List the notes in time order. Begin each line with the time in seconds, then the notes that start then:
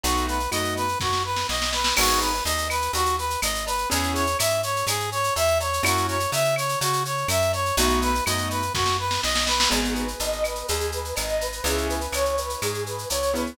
0.03 B1 A3 B3 D#4 F#4, cowbell, shaker
0.17 shaker
0.28 B4, shaker
0.40 shaker
0.51 F#2 A3 B3 D#4 F#4 D#5, claves, shaker
0.65 shaker
0.76 B4, shaker
0.88 shaker
1.00 F#2 F#4, kick, snare
1.13 snare
1.25 B4
1.36 snare
1.49 B1 D#5, snare
1.62 snare
1.73 B4, snare
1.84 snare
1.96 G#1 B3 D#4 F#4 G#4, crash, cowbell, claves
2.09 shaker
2.21 B4, shaker
2.34 shaker
2.45 D#2 D#5, cowbell, shaker
2.58 shaker
2.70 B4, claves, shaker
2.82 shaker
2.93 D#2 F#4, cowbell, shaker
3.05 shaker
3.18 B4, shaker
3.30 shaker
3.42 G#1 D#5, cowbell, claves, shaker
3.55 shaker
3.66 B4, cowbell, shaker
3.78 shaker
3.90 E2 B3 C#4 E4 G#4, cowbell, shaker
4.03 shaker
4.15 C#5, shaker
4.27 shaker
4.39 G#2 E5, cowbell, claves, shaker
4.50 shaker
4.63 C#5, shaker
4.76 shaker
4.87 G#2 G#4, cowbell, claves, shaker
5.00 shaker
5.12 C#5, shaker
5.23 shaker
5.36 E2 E5, cowbell, shaker
5.47 shaker
5.60 C#5, cowbell, shaker
5.73 shaker
5.83 F#2 A#3 C#4 E4 F#4, cowbell, claves, shaker
5.97 shaker
6.08 C#5, shaker
6.20 shaker
6.32 C#3 E5, cowbell, shaker
6.44 shaker
6.56 C#5, claves, shaker
6.69 shaker
6.81 C#3 F#4, cowbell, shaker
6.93 shaker
7.05 C#5, shaker
7.17 shaker
7.28 F#2 E5, cowbell, claves, shaker
7.42 shaker
7.53 C#5, cowbell, shaker
7.66 shaker
7.77 B1 A3 B3 D#4 F#4, cowbell, shaker
7.89 shaker
8.02 B4, shaker
8.15 shaker
8.26 F#2 A3 B3 D#4 F#4 D#5, claves, shaker
8.38 shaker
8.50 B4, shaker
8.62 shaker
8.74 F#2 F#4, kick, snare
8.86 snare
8.99 B4
9.11 snare
9.23 B1 D#5, snare
9.35 snare
9.47 B4, snare
9.60 snare
9.70 G#1 B3 D#4 F#4 G#4, cowbell, shaker
9.85 shaker
9.95 B4, shaker
10.08 shaker
10.19 G#1 D#5, cowbell, shaker
10.32 shaker
10.44 B4, claves, shaker
10.55 shaker
10.68 D#2 G#4, cowbell, shaker
10.80 shaker
10.92 B4, shaker
11.05 shaker
11.16 G#1 D#5, cowbell, claves, shaker
11.29 shaker
11.40 B4, cowbell, shaker
11.52 shaker
11.64 C#2 B3 C#4 E4 G#4, cowbell, shaker
11.78 shaker
11.89 B4, shaker
12.01 shaker
12.12 C#2 C#5, cowbell, claves, shaker
12.25 shaker
12.37 B4, shaker
12.49 shaker
12.62 G#2 G#4, cowbell, claves, shaker
12.74 shaker
12.86 B4, shaker
12.98 shaker
13.10 C#2 C#5, cowbell, shaker
13.22 shaker
13.34 B3 C#4 E4 G#4 B4, cowbell, shaker
13.46 shaker